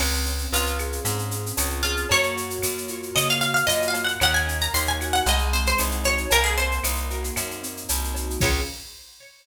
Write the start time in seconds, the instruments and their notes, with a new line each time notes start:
0.00 electric bass (finger) C#2, acoustic grand piano C4, crash, cowbell, claves
0.13 shaker
0.26 acoustic grand piano C#4, shaker
0.38 shaker
0.52 electric bass (finger) C#2, acoustic grand piano F4, acoustic guitar (steel) F4, tambourine, shaker
0.66 shaker
0.79 acoustic grand piano G#4, claves, shaker
0.92 shaker
1.05 electric bass (finger) G#2, acoustic grand piano C4, cowbell, shaker
1.19 shaker
1.31 acoustic grand piano C#4, shaker
1.46 shaker
1.57 electric bass (finger) C#2, acoustic grand piano F4, tambourine, cowbell, claves, shaker
1.70 shaker
1.83 acoustic guitar (steel) F4, acoustic grand piano G#4, cowbell, shaker
1.97 shaker
2.09 electric bass (finger) F#2, acoustic grand piano A#3, acoustic guitar (steel) C#5, cowbell, shaker
2.23 shaker
2.36 acoustic grand piano F#4, shaker
2.50 shaker
2.63 electric bass (finger) F#2, acoustic grand piano A#3, tambourine, claves, shaker
2.78 shaker
2.88 acoustic grand piano F4, shaker
3.03 shaker
3.15 electric bass (finger) C#3, acoustic grand piano A#3, acoustic guitar (steel) D#5, cowbell, claves, shaker
3.29 acoustic guitar (steel) F5, shaker
3.41 acoustic grand piano F#4, acoustic guitar (steel) F5, shaker
3.54 acoustic guitar (steel) F5, shaker
3.67 electric bass (finger) F#2, acoustic grand piano F4, acoustic guitar (steel) D#5, tambourine, cowbell, shaker
3.82 shaker
3.88 acoustic guitar (steel) F5
3.94 acoustic grand piano A#3, cowbell, shaker
4.04 acoustic guitar (steel) F#5, shaker
4.20 electric bass (finger) D#2, acoustic grand piano A#3, acoustic guitar (steel) F#5, cowbell, claves, shaker
4.34 acoustic guitar (steel) G#5, shaker
4.47 acoustic grand piano C#4, shaker
4.61 acoustic guitar (steel) A#5, shaker
4.74 electric bass (finger) D#2, acoustic grand piano D#4, acoustic guitar (steel) C6, tambourine, shaker
4.86 acoustic guitar (steel) G#5, shaker
5.00 acoustic grand piano F#4, claves, shaker
5.13 acoustic guitar (steel) F#5, shaker
5.26 electric bass (finger) C2, acoustic grand piano G#3, acoustic guitar (steel) D#5, cowbell, shaker
5.38 shaker
5.53 acoustic grand piano C4, acoustic guitar (steel) C5, shaker
5.66 acoustic guitar (steel) C5, shaker
5.78 electric bass (finger) C2, acoustic grand piano D#4, tambourine, cowbell, claves, shaker
5.91 shaker
6.04 acoustic grand piano F#4, acoustic guitar (steel) C#5, cowbell, shaker
6.17 shaker
6.30 electric bass (finger) C2, acoustic grand piano A#3, acoustic guitar (steel) A#4, cowbell, shaker
6.44 acoustic guitar (steel) G#4, shaker
6.57 acoustic grand piano C4, acoustic guitar (steel) C5, shaker
6.71 shaker
6.84 electric bass (finger) C2, acoustic grand piano D#4, tambourine, claves, shaker
6.96 shaker
7.10 acoustic grand piano F#4, shaker
7.24 shaker
7.36 electric bass (finger) F#2, acoustic grand piano A#3, cowbell, claves, shaker
7.51 shaker
7.63 acoustic grand piano C4, shaker
7.77 shaker
7.89 electric bass (finger) C2, acoustic grand piano D#4, tambourine, cowbell, shaker
8.04 shaker
8.14 acoustic grand piano F#4, cowbell, shaker
8.30 shaker
8.40 electric bass (finger) C#2, acoustic grand piano C4 C#4 F4 G#4, acoustic guitar (steel) C#5, kick, crash